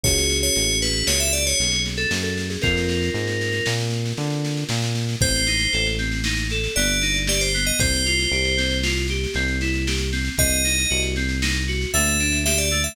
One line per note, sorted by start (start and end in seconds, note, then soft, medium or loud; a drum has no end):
0.04 0.50 C#2 medium
0.04 2.57 C#4 medium
0.04 2.57 F#4 medium
0.04 2.57 G#4 medium
0.04 0.37 C#5 medium
0.04 kick medium
0.04 snare medium
0.18 snare medium
0.30 snare medium
0.43 0.78 C#5 medium
0.43 snare medium
0.55 1.03 A1 medium
0.55 snare medium
0.69 snare medium
0.82 1.06 B4 medium
0.82 snare medium
0.95 snare medium
1.07 1.54 C#2 medium
1.07 1.20 C#5 medium
1.07 snare loud
1.20 1.33 E5 medium
1.20 snare medium
1.33 1.45 D5 medium
1.33 snare medium
1.46 1.82 C#5 medium
1.46 snare medium
1.59 2.06 B1 medium
1.59 snare medium
1.72 snare medium
1.85 snare medium
1.97 2.10 A4 medium
1.97 snare medium
2.11 2.57 F#2 medium
2.11 snare loud
2.23 2.47 A4 medium
2.23 snare medium
2.37 snare medium
2.50 2.62 G#4 medium
2.50 snare medium
2.62 3.10 F2 medium
2.62 5.16 C4 medium
2.62 5.16 F4 medium
2.62 3.68 A#4 medium
2.62 5.16 A#4 medium
2.62 kick medium
2.62 snare medium
2.77 snare medium
2.89 snare medium
3.03 snare medium
3.14 3.61 G#2 medium
3.14 snare medium
3.27 snare medium
3.41 snare medium
3.52 snare medium
3.66 4.13 A#2 medium
3.66 snare loud
3.80 snare medium
3.91 snare medium
4.05 snare medium
4.17 4.64 D3 medium
4.17 snare medium
4.30 snare medium
4.45 snare medium
4.57 snare medium
4.69 5.16 A#2 medium
4.69 snare medium
4.82 snare medium
4.95 snare medium
5.09 snare medium
5.20 5.68 A1 medium
5.20 5.45 C4 medium
5.20 5.87 C5 medium
5.20 kick loud
5.20 snare medium
5.35 snare medium
5.47 5.70 D#4 medium
5.47 snare medium
5.59 snare medium
5.73 6.69 A1 medium
5.73 5.96 A4 medium
5.73 snare medium
5.86 snare medium
5.98 6.22 C4 medium
5.98 snare medium
6.12 snare medium
6.24 6.48 D#4 medium
6.24 snare loud
6.37 snare medium
6.50 6.74 A4 medium
6.50 snare medium
6.64 snare medium
6.76 7.72 G1 loud
6.76 6.99 B3 medium
6.76 7.18 D5 medium
6.76 snare medium
6.88 snare medium
7.01 7.25 D#4 medium
7.01 snare medium
7.14 snare medium
7.27 7.51 G4 medium
7.27 7.41 D5 medium
7.27 snare loud
7.41 7.64 C5 medium
7.41 snare medium
7.54 7.77 B3 medium
7.54 snare medium
7.65 7.79 D#5 medium
7.65 snare medium
7.79 8.27 C2 medium
7.79 8.03 C4 medium
7.79 8.77 C5 medium
7.79 kick loud
7.79 snare medium
7.94 snare medium
8.05 8.29 F4 medium
8.05 snare medium
8.19 snare medium
8.32 9.27 C2 medium
8.32 8.55 G4 medium
8.32 snare medium
8.45 snare medium
8.57 8.80 C4 medium
8.57 snare medium
8.71 snare medium
8.83 9.06 F4 medium
8.83 snare loud
8.97 snare medium
9.08 9.33 G4 medium
9.08 snare medium
9.24 snare medium
9.34 10.30 C2 medium
9.34 9.58 C4 medium
9.34 snare medium
9.48 snare medium
9.61 9.84 E4 medium
9.61 snare medium
9.74 snare medium
9.87 10.10 G4 medium
9.87 snare medium
9.98 snare medium
10.12 10.35 C4 medium
10.12 snare medium
10.25 snare medium
10.38 10.86 C2 medium
10.38 10.62 C4 medium
10.38 11.01 D#5 medium
10.38 kick medium
10.38 snare medium
10.50 snare medium
10.64 10.87 D#4 medium
10.64 snare medium
10.78 snare medium
10.90 11.86 C2 medium
10.90 11.13 F#4 medium
10.90 snare medium
11.02 snare medium
11.16 11.40 C4 medium
11.16 snare medium
11.29 snare medium
11.42 11.65 D#4 medium
11.42 snare loud
11.54 snare medium
11.67 11.91 F#4 medium
11.67 snare medium
11.81 snare medium
11.94 12.89 D2 loud
11.94 12.17 A3 medium
11.94 12.38 E5 medium
11.94 snare medium
12.06 snare medium
12.20 12.43 D4 medium
12.20 snare medium
12.32 snare medium
12.45 12.69 G4 medium
12.45 12.58 E5 medium
12.45 snare loud
12.58 12.82 D5 medium
12.58 snare medium
12.71 12.95 A3 medium
12.71 snare medium
12.84 12.95 E5 medium
12.84 snare medium